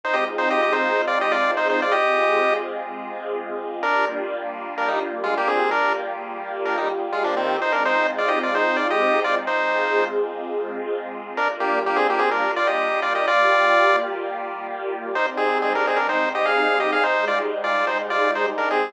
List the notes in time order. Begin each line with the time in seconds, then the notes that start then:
0.04 G#3 C4 D#4 F4 C5
0.14 G4 D#5
0.38 D#4 C5
0.50 G4 D#5
0.62 G4 D#5
0.73 D#4 C5
1.07 F4 D5
1.21 G4 D#5
1.32 F4 D5
1.57 D#4 C5
1.70 D#4 C5
1.82 F4 D5
1.92 G#3 C4 F4 G4 G#4 D#5
3.81 G3 A#3 D4 F4 A#4
4.78 D4 A#4
4.88 G3 D#4
5.24 G#3 F4
5.37 A#3 G4
5.47 C4 G#4
5.70 G3 A#3 D4 F4 G4 A#4
6.65 D4 A#4
6.77 G3 D#4
7.13 G#3 F4
7.24 F3 D4
7.37 D#3 C4
7.58 G#3 C4 D#4 F4 C5
7.72 D4 A#4
7.85 D#4 C5
8.18 F4 D5
8.28 G4 D#5
8.43 F4 D5
8.55 D#4 C5
8.77 F4 D5
8.90 G4 D#5
9.24 F4 D5
9.47 G#3 C4 D#4 F4 G#4 C5
11.37 G3 A#3 D4 F4 A#4
11.60 A#3 G4
11.86 A#3 G4
11.96 C4 G#4
12.10 A#3 G4
12.19 C4 G#4
12.31 D4 A#4
12.56 F4 D5
12.67 G4 D#5
13.02 F4 D5
13.15 G4 D#5
13.27 G3 A#3 F4 G4 D5
15.15 G#2 G3 C4 D#4 C5
15.37 C4 G#4
15.62 C4 G#4
15.75 D4 A#4
15.87 C4 G#4
15.96 D4 A#4
16.09 D#4 C5
16.35 G4 D#5
16.45 G#4 F5
16.80 G4 D#5
16.93 G#4 F5
17.04 G#2 G3 G#3 D#4 C5
17.28 F4 D5
17.64 F4 D5
17.87 D#4 C5
18.10 F4 D5
18.35 D#4 C5
18.58 D4 A#4
18.71 C4 G#4